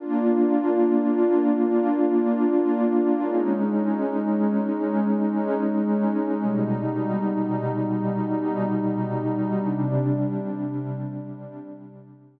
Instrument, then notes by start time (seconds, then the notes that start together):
pad 2 (warm)
0.00 A#3 D4 F4
3.20 G#3 C#4 D#4
6.40 B2 G3 D#4
9.60 C3 G3 D4